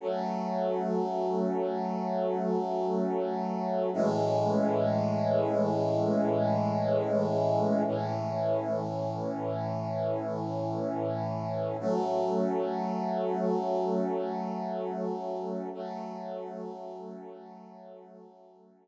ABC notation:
X:1
M:4/4
L:1/8
Q:1/4=122
K:F#m
V:1 name="Brass Section"
[F,A,C]8- | [F,A,C]8 | [A,,E,G,C]8- | [A,,E,G,C]8 |
[A,,E,C]8- | [A,,E,C]8 | [F,A,C]8- | [F,A,C]8 |
[F,A,C]8- | [F,A,C]8 |]